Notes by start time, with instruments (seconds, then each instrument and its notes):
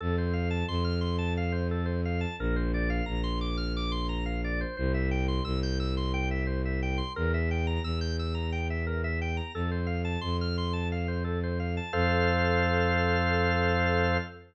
0.01 violin F2, drawbar organ A4
0.18 drawbar organ C5
0.33 drawbar organ F5
0.50 drawbar organ A5
0.68 violin F2, drawbar organ C6
0.84 drawbar organ F6
1.01 drawbar organ C6
1.18 drawbar organ A5
1.37 drawbar organ F5
1.52 drawbar organ C5
1.71 drawbar organ A4
1.86 drawbar organ C5
2.05 drawbar organ F5
2.21 drawbar organ A5
2.39 violin A#1, drawbar organ A#4
2.56 drawbar organ C5
2.74 drawbar organ D5
2.90 drawbar organ F5
3.06 violin A#1, drawbar organ A#5
3.24 drawbar organ C6
3.41 drawbar organ D6
3.57 drawbar organ F6
3.77 drawbar organ D6
3.92 drawbar organ C6
4.09 drawbar organ A#5
4.26 drawbar organ F5
4.44 drawbar organ D5
4.61 drawbar organ C5
4.77 violin C2, drawbar organ C5
4.94 drawbar organ E5
5.11 drawbar organ G5
5.28 drawbar organ C6
5.45 violin C2, drawbar organ E6
5.63 drawbar organ G6
5.80 drawbar organ E6
5.97 drawbar organ C6
6.14 drawbar organ G5
6.31 drawbar organ E5
6.47 drawbar organ C5
6.65 drawbar organ E5
6.83 drawbar organ G5
6.98 drawbar organ C6
7.16 violin E2, drawbar organ A#4
7.34 drawbar organ E5
7.51 drawbar organ G5
7.67 drawbar organ A#5
7.84 violin E2, drawbar organ E6
8.01 drawbar organ G6
8.19 drawbar organ E6
8.35 drawbar organ A#5
8.52 drawbar organ G5
8.70 drawbar organ E5
8.87 drawbar organ A#4
9.04 drawbar organ E5
9.22 drawbar organ G5
9.37 drawbar organ A#5
9.54 violin F2, drawbar organ A4
9.71 drawbar organ C5
9.87 drawbar organ F5
10.05 drawbar organ A5
10.21 violin F2, drawbar organ C6
10.41 drawbar organ F6
10.58 drawbar organ C6
10.73 drawbar organ A5
10.92 drawbar organ F5
11.08 drawbar organ C5
11.24 drawbar organ A4
11.43 drawbar organ C5
11.60 drawbar organ F5
11.77 drawbar organ A5
11.93 violin F2, drawbar organ A4 C5 F5